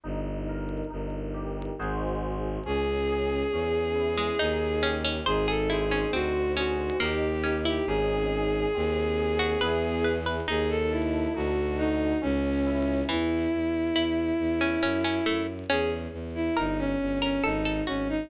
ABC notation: X:1
M:3/4
L:1/16
Q:1/4=69
K:C#m
V:1 name="Violin"
z12 | G12 | G A G2 F2 F2 =G3 G | G12 |
G A E2 F2 D2 C4 | [K:E] E12 | G z2 E D C2 C D2 C D |]
V:2 name="Harpsichord"
z12 | z7 G, D2 C C | ^B G E C ^B,2 C2 ^A,2 C E | z7 F B2 B B |
D8 z4 | [K:E] E,4 E3 C C C A, z | C4 ^A3 A =A A F z |]
V:3 name="Electric Piano 2"
D2 ^A2 D2 =G2 [DF^G^B]4 | C2 G2 C2 E2 D2 =G2 | D2 ^B2 D2 G2 D2 =G2 | [CDG]4 ^B,2 G2 [=B,EG]4 |
D2 A2 D2 F2 C2 E2 | [K:E] z12 | z12 |]
V:4 name="Violin" clef=bass
=G,,,4 G,,,4 ^G,,,4 | C,,4 E,,4 D,,4 | G,,,4 =D,,4 ^D,,4 | G,,,4 D,,4 E,,4 |
D,,4 =D,,4 C,,4 | [K:E] E,,2 E,,2 E,,2 E,,2 F,,2 F,,2 | E,,2 E,,2 =G,,,2 G,,,2 ^G,,,2 G,,,2 |]